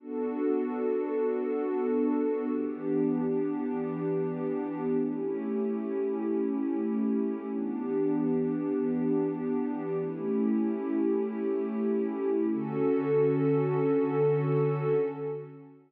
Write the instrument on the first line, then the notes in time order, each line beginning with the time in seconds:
pad 2 (warm)
0.00 B3 D4 F#4 A4
2.49 E3 B3 D4 G4
4.99 A3 C#4 E4 G4
7.50 E3 B3 D4 G4
9.99 A3 C#4 E4 G4
12.51 D3 C#4 F#4 A4